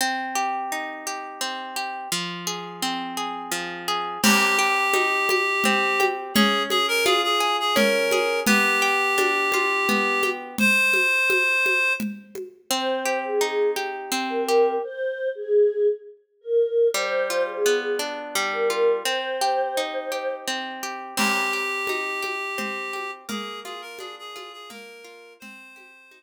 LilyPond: <<
  \new Staff \with { instrumentName = "Clarinet" } { \time 3/4 \key c \minor \tempo 4 = 85 r2. | r2. | g'2. | aes'8 aes'16 bes'16 aes'16 aes'8 aes'16 bes'4 |
g'2. | c''2 r4 | r2. | r2. |
r2. | r2. | g'2. | aes'8 aes'16 bes'16 aes'16 aes'8 aes'16 bes'4 |
c''4. r4. | }
  \new Staff \with { instrumentName = "Choir Aahs" } { \time 3/4 \key c \minor r2. | r2. | r2. | r2. |
r2. | r2. | c''8. aes'8. r8. bes'8. | c''8. aes'8. r8. bes'8. |
c''8. aes'8. r8. bes'8. | c''2 r4 | r2. | r2. |
r2. | }
  \new Staff \with { instrumentName = "Orchestral Harp" } { \time 3/4 \key c \minor c'8 g'8 ees'8 g'8 c'8 g'8 | f8 aes'8 c'8 aes'8 f8 aes'8 | c'8 g'8 ees'8 g'8 c'8 g'8 | des'8 aes'8 f'8 aes'8 des'8 aes'8 |
b8 g'8 d'8 f'8 b8 g'8 | r2. | c'8 g'8 ees'8 g'8 c'8 g'8 | r2. |
g8 f'8 b8 d'8 g8 f'8 | c'8 g'8 ees'8 g'8 c'8 g'8 | c'8 g'8 ees'8 g'8 c'8 g'8 | bes8 f'8 d'8 f'8 bes8 f'8 |
c'8 g'8 ees'8 r4. | }
  \new DrumStaff \with { instrumentName = "Drums" } \drummode { \time 3/4 r4 r4 r4 | r4 r4 r4 | <cgl cymc>4 cgho8 cgho8 cgl8 cgho8 | cgl8 cgho8 cgho4 cgl8 cgho8 |
cgl4 cgho8 cgho8 cgl8 cgho8 | cgl8 cgho8 cgho8 cgho8 cgl8 cgho8 | r4 r4 r4 | r4 r4 r4 |
r4 r4 r4 | r4 r4 r4 | <cgl cymc>4 cgho8 cgho8 cgl8 cgho8 | cgl8 cgho8 cgho8 cgho8 cgl4 |
cgl8 cgho8 cgho4 r4 | }
>>